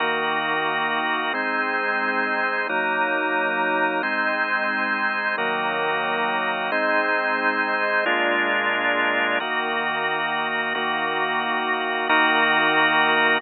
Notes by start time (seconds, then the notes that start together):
0.00 D#3 A#3 D#4 F#4 A#4
1.34 G#3 C4 D#4 C5
2.69 F#3 A#3 D#4 A#4
4.03 G#3 C4 D#4 C5
5.38 D#3 F#3 A#3 D#4 F#4 A#4
6.72 G#3 C4 D#4 C5
8.06 A#2 G#3 A#3 D4 F4 G#4
9.40 D#3 A#3 D#4 F#4 A#4
10.75 D#3 A#3 D#4 F#4 A#4
12.09 D#3 A#3 D#4 F#4 A#4